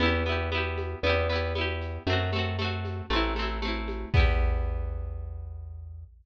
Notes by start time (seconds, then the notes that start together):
0.00 E2 B3 E4, low conga, shaker
0.06 G4
0.26 B3 E4, high conga, shaker
0.32 G4
0.52 B3 E4, high conga, shaker
0.58 G4
0.78 high conga, shaker
1.03 E2 B3 E4, low conga, shaker
1.09 G4
1.29 B3 E4, snare, shaker
1.35 G4
1.55 B3 E4, high conga, shaker
1.61 G4
1.81 shaker
2.07 F#2 A3 C4, low conga, shaker
2.13 F#4
2.32 A3 C4, high conga, shaker
2.39 F#4
2.59 A3 C4, high conga, shaker
2.65 F#4
2.85 high conga, shaker
3.10 A1 A3 C4, low conga, shaker
3.16 E4
3.36 A3 C4, snare, high conga, shaker
3.42 E4
3.62 A3 C4, high conga, shaker
3.68 E4
3.88 high conga, shaker
4.14 E2 B3 E4, kick, crash
4.20 G4